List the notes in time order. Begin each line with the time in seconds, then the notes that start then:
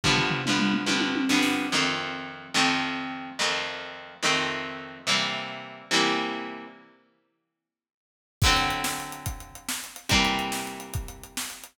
0.04 G2 D3 F3 B3, kick, floor tom
0.17 floor tom
0.30 floor tom
0.46 G2 D3 F3 B3, mid tom
0.59 mid tom
0.74 mid tom
0.86 G2 D3 F3 B3, high tom
1.00 high tom
1.15 high tom
1.29 G2 D3 F3 B3, snare
1.43 snare
1.72 F2 D#3 A3 C4
2.54 F2 D#3 A3 C4
3.39 F2 D#3 A3 C4
4.23 F2 D#3 A3 C4
5.07 C3 E3 G3 A#3
5.91 C3 E3 G3 A#3
8.42 D3 F#3 A3, kick, crash
8.46 C4
8.57 closed hi-hat
8.70 closed hi-hat
8.84 snare
9.00 closed hi-hat
9.12 closed hi-hat
9.26 kick, closed hi-hat
9.40 closed hi-hat
9.55 closed hi-hat
9.69 snare
9.84 closed hi-hat
9.96 closed hi-hat
10.09 C3 E3 G3 A#3, kick, closed hi-hat
10.25 closed hi-hat
10.39 closed hi-hat
10.52 snare
10.67 closed hi-hat
10.80 closed hi-hat
10.94 kick, closed hi-hat
11.08 closed hi-hat
11.23 closed hi-hat
11.37 snare
11.50 closed hi-hat
11.64 closed hi-hat